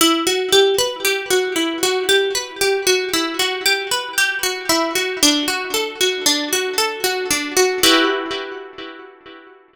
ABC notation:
X:1
M:5/4
L:1/8
Q:1/4=115
K:Edor
V:1 name="Pizzicato Strings"
E F G B G F E F G B | G F E F G B G F E F | D F A F D F A F D F | [EFGB]10 |]